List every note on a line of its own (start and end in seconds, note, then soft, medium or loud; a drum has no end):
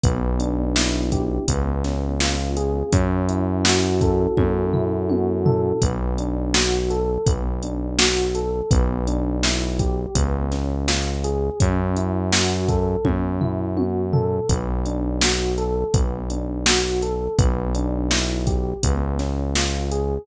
0.03 1.39 B1 loud
0.03 1.42 B3 medium
0.03 kick loud
0.03 closed hi-hat loud
0.40 1.44 D4 medium
0.40 closed hi-hat medium
0.76 1.45 E4 medium
0.76 snare medium
1.12 1.47 G4 medium
1.12 kick medium
1.12 closed hi-hat medium
1.48 2.84 C#2 medium
1.48 2.87 B3 medium
1.48 kick medium
1.48 closed hi-hat loud
1.84 2.88 C#4 medium
1.84 snare soft
1.84 closed hi-hat medium
2.20 2.90 F4 medium
2.20 snare medium
2.56 2.91 G#4 medium
2.56 closed hi-hat medium
2.92 4.27 F#2 loud
2.92 4.37 C#4 medium
2.92 kick medium
2.92 closed hi-hat loud
3.29 4.73 E4 medium
3.29 closed hi-hat medium
3.65 5.09 F#4 medium
3.65 snare loud
4.01 5.45 A4 medium
4.01 kick medium
4.01 closed hi-hat medium
4.37 5.73 F#2 medium
4.37 5.76 C#4 medium
4.37 kick medium
4.37 high tom medium
4.73 5.77 E4 medium
4.73 floor tom medium
5.09 5.79 F#4 medium
5.09 high tom medium
5.46 5.80 A4 medium
5.46 floor tom loud
5.82 7.18 B1 medium
5.82 6.18 B3 medium
5.82 kick medium
5.82 closed hi-hat loud
6.18 6.54 D4 medium
6.18 closed hi-hat medium
6.54 6.90 F#4 medium
6.54 snare loud
6.90 7.26 A4 medium
6.90 closed hi-hat medium
7.26 8.62 B1 medium
7.26 7.63 B3 medium
7.26 kick medium
7.26 closed hi-hat loud
7.63 7.99 D4 medium
7.63 closed hi-hat medium
7.98 8.35 F#4 medium
7.98 snare loud
8.35 8.70 A4 medium
8.35 closed hi-hat medium
8.71 10.06 B1 loud
8.71 9.07 B3 medium
8.71 kick loud
8.71 closed hi-hat loud
9.07 9.43 D4 medium
9.07 closed hi-hat medium
9.43 9.79 E4 medium
9.43 snare medium
9.79 10.14 G4 medium
9.79 kick medium
9.79 closed hi-hat medium
10.15 11.50 C#2 medium
10.15 10.52 B3 medium
10.15 kick medium
10.15 closed hi-hat loud
10.52 10.88 C#4 medium
10.52 snare soft
10.52 closed hi-hat medium
10.88 11.24 F4 medium
10.88 snare medium
11.24 11.59 G#4 medium
11.24 closed hi-hat medium
11.60 12.96 F#2 loud
11.60 11.96 C#4 medium
11.60 kick medium
11.60 closed hi-hat loud
11.96 12.32 E4 medium
11.96 closed hi-hat medium
12.32 12.68 F#4 medium
12.32 snare loud
12.69 13.05 A4 medium
12.69 kick medium
12.69 closed hi-hat medium
13.05 14.40 F#2 medium
13.05 13.41 C#4 medium
13.05 kick medium
13.05 high tom medium
13.41 13.77 E4 medium
13.41 floor tom medium
13.77 14.13 F#4 medium
13.77 high tom medium
14.13 14.48 A4 medium
14.13 floor tom loud
14.49 15.84 B1 medium
14.49 14.85 B3 medium
14.49 kick medium
14.49 closed hi-hat loud
14.85 15.22 D4 medium
14.85 closed hi-hat medium
15.21 15.58 F#4 medium
15.21 snare loud
15.58 15.94 A4 medium
15.58 closed hi-hat medium
15.93 17.28 B1 medium
15.93 16.30 B3 medium
15.93 kick medium
15.93 closed hi-hat loud
16.30 16.66 D4 medium
16.30 closed hi-hat medium
16.66 17.02 F#4 medium
16.66 snare loud
17.02 17.37 A4 medium
17.02 closed hi-hat medium
17.38 18.73 B1 loud
17.38 17.75 B3 medium
17.38 kick loud
17.38 closed hi-hat loud
17.75 18.11 D4 medium
17.75 closed hi-hat medium
18.11 18.47 E4 medium
18.11 snare medium
18.47 18.81 G4 medium
18.47 kick medium
18.47 closed hi-hat medium
18.83 20.19 C#2 medium
18.83 19.19 B3 medium
18.83 kick medium
18.83 closed hi-hat loud
19.19 19.55 C#4 medium
19.19 snare soft
19.19 closed hi-hat medium
19.55 19.91 F4 medium
19.55 snare medium
19.91 20.26 G#4 medium
19.91 closed hi-hat medium